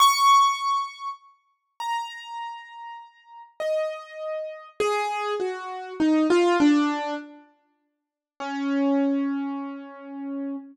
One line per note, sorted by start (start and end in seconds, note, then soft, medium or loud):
0.00 1.08 C#6 loud
1.80 3.42 A#5 medium
3.60 4.68 D#5 medium
4.80 5.34 G#4 loud
5.40 5.94 F#4 medium
6.00 6.27 D#4 medium
6.30 6.57 F4 loud
6.60 7.14 D4 loud
8.40 10.56 C#4 medium